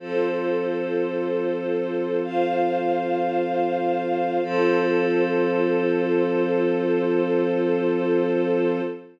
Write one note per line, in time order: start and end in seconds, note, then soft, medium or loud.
0.00 4.39 F3 medium
0.00 4.39 C4 medium
0.00 2.20 F4 medium
0.00 2.20 A4 loud
0.00 4.39 A4 medium
0.00 2.20 C5 loud
2.22 4.42 F4 medium
2.22 4.42 C5 loud
2.22 4.42 F5 medium
4.44 8.81 F3 loud
4.44 8.81 C4 loud
4.44 8.81 F4 loud
4.44 8.81 A4 loud
4.44 8.81 C5 loud